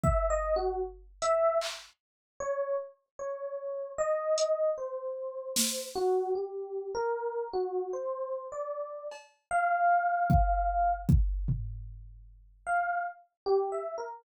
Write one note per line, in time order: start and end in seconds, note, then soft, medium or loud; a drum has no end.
0.04 0.27 E5 loud
0.04 kick loud
0.30 0.54 D#5 loud
0.56 0.80 F#4 loud
1.22 1.58 E5 loud
1.22 closed hi-hat medium
1.62 clap medium
2.40 2.76 C#5 loud
3.19 3.90 C#5 medium
3.98 4.69 D#5 loud
4.38 closed hi-hat medium
4.78 5.84 C5 medium
5.56 snare medium
5.96 6.31 F#4 loud
6.35 6.89 G4 medium
6.95 7.48 A#4 loud
7.53 7.89 F#4 loud
7.93 8.47 C5 medium
8.52 9.05 D5 medium
9.12 cowbell medium
9.51 10.93 F5 loud
10.30 kick loud
11.09 kick loud
11.48 floor tom loud
12.67 13.02 F5 loud
13.46 13.70 G4 loud
13.72 13.96 E5 medium
13.98 14.22 A#4 medium